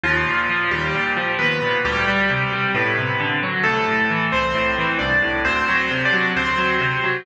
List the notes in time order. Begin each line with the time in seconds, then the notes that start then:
0.03 D#2 F3 F4
0.26 A#2
0.50 F3
0.71 D#2 G3 G4
0.95 A#2
1.17 F3
1.39 D#2 B3 B4
1.62 A#2
1.85 D2 G3 G4
2.08 G3
2.30 C3
2.53 G3
2.74 A2 B3 B4
2.98 C3
3.20 D3
3.43 F#3
3.63 C2 A3 A4
3.88 A2
4.10 E3
4.32 C2 C4 C5
4.55 A2
4.78 E3
4.99 C2 D4 D5
5.22 A2
5.45 D2 C4 C5
5.68 F#3
5.75 C4 C5
5.91 C3
6.05 D4 D5
6.13 F#3
6.36 D2 C4 C5
6.58 F#3
6.81 C3
7.04 F#3